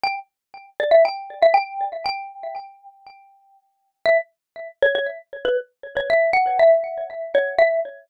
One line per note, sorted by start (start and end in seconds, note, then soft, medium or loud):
0.04 0.16 G5 loud
0.80 0.92 D5 medium
0.91 1.03 E5 medium
1.05 1.39 G5 loud
1.43 1.55 E5 loud
1.54 1.84 G5 medium
2.06 3.01 G5 loud
4.06 4.18 E5 loud
4.83 4.95 C#5 loud
4.95 5.07 C#5 medium
5.45 5.57 B4 loud
5.97 6.09 C#5 loud
6.10 6.31 E5 loud
6.33 6.58 F#5 loud
6.59 7.03 E5 loud
7.35 7.55 C#5 loud
7.59 7.80 E5 loud